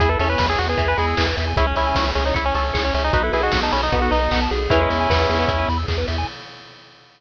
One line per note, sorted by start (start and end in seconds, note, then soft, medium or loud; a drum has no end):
0.00 0.17 E2 medium
0.00 1.53 B3 medium
0.00 1.53 E4 medium
0.00 0.20 E4 medium
0.00 0.09 G#4 loud
0.00 1.53 G#4 medium
0.00 0.09 G#4 loud
0.00 kick loud
0.00 closed hi-hat loud
0.09 0.19 A4 medium
0.09 0.18 B4 medium
0.19 0.36 E2 medium
0.19 0.70 C#4 medium
0.19 0.29 A4 medium
0.19 0.28 E5 medium
0.19 open hi-hat medium
0.29 0.46 B4 medium
0.29 0.38 G#5 medium
0.38 0.56 E2 medium
0.38 0.48 B5 medium
0.38 kick loud
0.38 snare loud
0.50 0.59 G#4 loud
0.50 0.58 E6 medium
0.58 0.76 E2 medium
0.58 0.68 F#4 medium
0.58 0.67 G#4 medium
0.58 open hi-hat medium
0.69 0.88 G#4 medium
0.69 0.78 B4 medium
0.77 0.95 E2 medium
0.77 0.94 E3 medium
0.77 0.86 E5 medium
0.77 kick loud
0.77 closed hi-hat loud
0.88 0.97 B4 loud
0.88 0.98 G#5 medium
0.97 1.15 E2 medium
0.97 1.14 G#3 medium
0.97 1.24 G#4 medium
0.97 1.06 B5 medium
0.97 open hi-hat medium
1.07 1.16 E6 medium
1.17 1.34 E2 medium
1.17 1.52 E3 loud
1.17 1.26 G#4 medium
1.17 kick medium
1.17 clap loud
1.27 1.36 B4 medium
1.37 1.54 E2 medium
1.37 1.46 E5 medium
1.37 open hi-hat loud
1.47 1.56 G#5 medium
1.56 1.73 C#2 loud
1.56 3.13 C#4 medium
1.56 1.76 C#4 medium
1.56 1.66 E4 loud
1.56 3.13 E4 medium
1.56 1.66 G#4 medium
1.56 3.13 G#4 medium
1.56 kick loud
1.56 closed hi-hat loud
1.67 1.76 C#4 medium
1.67 1.75 C#5 medium
1.76 1.93 C#2 medium
1.76 2.11 C#4 medium
1.76 2.24 E4 loud
1.76 1.86 E5 medium
1.76 open hi-hat medium
1.87 1.96 G#5 medium
1.95 2.13 C#2 medium
1.95 2.05 C#6 medium
1.95 kick medium
1.95 snare loud
2.06 2.14 E6 medium
2.15 2.33 C#2 medium
2.15 2.24 C#4 medium
2.15 2.24 G#4 medium
2.15 open hi-hat medium
2.25 2.35 D#4 medium
2.25 2.35 C#5 medium
2.34 2.52 C#2 medium
2.34 2.45 E4 medium
2.34 2.52 C#5 medium
2.34 2.45 E5 medium
2.34 kick medium
2.34 closed hi-hat loud
2.45 2.55 C#4 loud
2.45 2.54 G#5 medium
2.54 2.72 C#2 medium
2.54 2.83 C#4 medium
2.54 2.72 A4 medium
2.54 2.64 C#6 medium
2.54 open hi-hat medium
2.65 2.74 E6 medium
2.74 2.91 C#2 medium
2.74 2.83 G#4 medium
2.74 3.10 C#5 medium
2.74 kick medium
2.74 clap loud
2.84 2.94 C#4 medium
2.84 2.93 C#5 medium
2.94 3.11 C#2 medium
2.94 3.04 C#4 medium
2.94 3.03 E5 medium
2.94 open hi-hat loud
3.04 3.13 D#4 loud
3.04 3.13 G#5 medium
3.13 3.30 B1 medium
3.13 4.69 B3 medium
3.13 3.23 D#4 loud
3.13 4.69 D#4 medium
3.13 3.22 F#4 loud
3.13 4.69 F#4 medium
3.13 4.69 A4 medium
3.13 3.33 B4 loud
3.13 kick loud
3.13 closed hi-hat loud
3.23 3.32 E4 medium
3.23 3.32 A4 medium
3.33 3.50 B1 medium
3.33 3.42 E4 medium
3.33 3.90 G#4 loud
3.33 3.41 B4 medium
3.33 open hi-hat medium
3.43 3.60 F#4 loud
3.43 3.52 D#5 medium
3.52 3.70 B1 medium
3.52 3.61 F#5 medium
3.52 kick medium
3.52 snare loud
3.63 3.72 D#4 medium
3.63 3.72 A5 medium
3.72 3.90 B1 medium
3.72 3.82 C#4 medium
3.72 3.81 B5 medium
3.72 open hi-hat loud
3.82 4.00 D#4 medium
3.82 3.91 D#6 medium
3.92 4.09 B1 medium
3.92 4.10 B3 medium
3.92 4.02 F#4 medium
3.92 kick loud
3.92 closed hi-hat loud
4.02 4.11 F#4 medium
4.02 4.11 A4 medium
4.11 4.28 B1 medium
4.11 4.29 D#4 medium
4.11 4.40 D#4 loud
4.11 4.20 B4 medium
4.11 open hi-hat medium
4.21 4.30 D#5 medium
4.31 4.48 B1 medium
4.31 4.68 B3 medium
4.31 4.40 F#5 loud
4.31 kick medium
4.31 clap loud
4.42 4.50 A5 medium
4.51 4.68 B1 medium
4.51 4.79 G#4 loud
4.51 open hi-hat medium
4.70 4.87 E2 medium
4.70 4.80 E3 loud
4.70 6.25 B3 medium
4.70 5.69 C#4 medium
4.70 6.25 E4 medium
4.70 5.69 E4 medium
4.70 6.25 G#4 medium
4.70 kick loud
4.70 closed hi-hat loud
4.80 5.07 G#3 medium
4.80 4.89 B4 medium
4.90 5.07 E2 medium
4.90 4.98 E5 medium
4.90 open hi-hat medium
5.00 5.09 G#5 medium
5.09 5.27 E2 medium
5.09 5.38 B3 medium
5.09 5.18 B5 medium
5.09 kick medium
5.09 snare loud
5.19 5.27 E6 medium
5.29 5.46 E2 medium
5.29 5.38 G#4 medium
5.29 open hi-hat medium
5.39 5.48 B3 loud
5.39 5.48 B4 medium
5.48 5.65 E2 medium
5.48 5.66 E4 medium
5.48 5.58 E5 medium
5.48 kick loud
5.48 closed hi-hat loud
5.59 5.67 G#5 medium
5.69 5.85 E2 medium
5.69 5.78 B5 medium
5.69 open hi-hat medium
5.77 5.86 E6 medium
5.88 6.05 E2 medium
5.88 5.97 G#4 medium
5.88 kick medium
5.88 clap loud
5.98 6.06 B4 medium
6.08 6.25 E2 medium
6.08 6.17 E5 medium
6.08 open hi-hat loud
6.18 6.27 G#5 medium